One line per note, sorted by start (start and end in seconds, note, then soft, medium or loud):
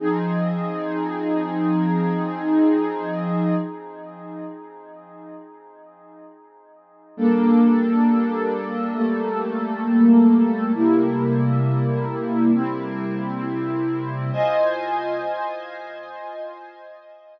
0.00 3.55 F3 medium
0.00 3.55 C4 medium
0.00 3.55 D#4 medium
0.00 3.55 G#4 medium
7.17 8.93 G3 medium
7.17 8.93 A#3 medium
7.17 8.94 D4 medium
7.17 8.93 A4 medium
8.94 10.71 G3 medium
8.94 10.71 A3 medium
8.94 10.71 A#3 medium
8.94 10.71 A4 medium
10.74 12.51 C3 medium
10.74 12.51 G3 medium
10.74 12.51 A#3 medium
10.74 12.51 E4 medium
12.53 14.31 C3 medium
12.53 14.31 G3 medium
12.53 14.31 C4 medium
12.53 14.31 E4 medium
14.32 17.39 F4 medium
14.32 17.39 C5 loud
14.32 17.39 D#5 medium
14.32 17.39 G#5 medium